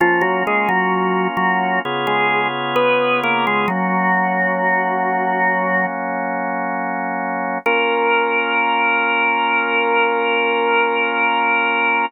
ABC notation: X:1
M:4/4
L:1/16
Q:1/4=65
K:Bbm
V:1 name="Drawbar Organ"
[F,F] [G,G] [A,A] [G,G]3 [G,G]2 z [A,A]2 z [_C_c]2 [B,B] [A,A] | "^rit." [G,G]10 z6 | B16 |]
V:2 name="Drawbar Organ"
[B,DF]8 [D,_CFA]8 | "^rit." [G,B,D]16 | [B,DF]16 |]